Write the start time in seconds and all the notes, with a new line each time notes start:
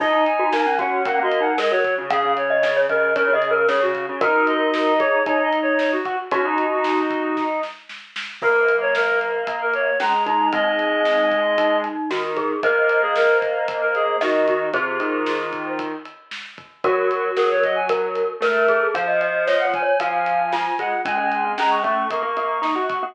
0.00 D#4 D#5, kick, crash
0.13 D#4
0.26 G#5, ride
0.39 F#4
0.52 A#3 D#4, snare
0.66 C#4
0.79 C#4 F#4 F#5, kick, ride
1.05 A#3 C#4 F#5, kick, ride
1.19 A#3 F#4
1.23 D#5
1.31 ride
1.40 D#4 F#5
1.58 G#3 A#4 D#5, snare
1.71 F#3 C#5
1.84 kick, ride
1.98 C#3
2.10 C#3 G#4 F5, kick, ride
2.23 C#3
2.37 C#5, ride
2.50 D#5
2.63 C#3 D#5, snare
2.77 C#5
2.89 C#3 A#4 D#5, kick, ride
3.16 C#3 A#4 C#5, kick, ride
3.28 C#3
3.33 G#4 D#5
3.42 ride
3.50 A#4
3.68 C#3 G#4 C#5, snare
3.80 C#3 F#4
3.94 kick, ride
4.09 C#3
4.21 D#4 F#4 A#4, kick, ride
4.47 D#5, ride
4.74 snare
4.99 G#4 C#5, kick, ride
5.26 D#4 C#5, kick, ride
5.43 D#5
5.53 ride
5.62 C#5
5.79 C#5, snare
5.92 F#4
6.05 F#4, kick, ride
6.31 C#4 D#4 F#4, kick, ride
6.45 D#4
6.58 ride
6.72 F#4
6.84 snare
7.10 kick, ride
7.37 kick, snare
7.63 snare
7.89 snare
8.16 snare
8.42 F#3 A#3 A#4, kick, crash
8.68 ride
8.81 C#5
8.95 A#4, snare
9.21 ride
9.47 A#3, kick, ride
9.62 A#4
9.73 C#5, ride
10.00 G#3 C#4 A#5, snare
10.26 D#4 A#5, kick, ride
10.52 G#3 C4 D#4 D#5, kick, ride
10.79 ride
11.05 snare
11.31 kick, ride
11.58 D#4, kick, ride
11.84 ride
12.10 D#3 F#4, snare
12.37 G#4, kick, ride
12.63 A#3 A#4 C5 D#5, kick, ride
12.89 ride
13.02 G#4
13.16 A#4, snare
13.42 kick, ride
13.68 kick, ride
13.81 A#4
13.95 G#4, ride
14.21 D#3 F#4 D#5, snare
14.47 F#4, kick, ride
14.73 C3 F4 G#4 C5, kick, ride
15.00 D#3, ride
15.26 F4, snare
15.53 kick, ride
15.79 kick, ride
16.05 ride
16.31 snare
16.58 kick, ride
16.84 F#3 F#4 A#4, kick, ride
17.11 F#4, ride
17.37 F#3 G#4 A#4, snare
17.51 C#5
17.63 D#5, kick, ride
17.75 G#5
17.89 A#4, kick, ride
18.15 ride
18.40 A3 A#4, snare
18.68 G#4, kick, ride
18.94 F3 C5 F5, kick, ride
19.08 D#5
19.21 D#5, ride
19.47 C#5 D#5, snare
19.60 F#5
19.65 C#5
19.74 G#5, kick, ride
19.83 C#5
20.00 F3 F5 G#5, kick, ride
20.26 ride
20.53 F4, snare
20.79 G#3 F#5, kick, ride
21.05 G#3 C#4 G#5, kick, ride
21.17 G#3
21.32 ride
21.45 C4
21.58 G#3 C#4 A#5, snare
21.71 C#6
21.83 A3 C#4 C#6, kick, ride
22.10 A#3 C#6, kick, ride
22.22 A#3
22.37 A#3, ride
22.62 D#4, snare
22.75 F#4
22.89 C#6, kick, ride
23.03 A#3 F#4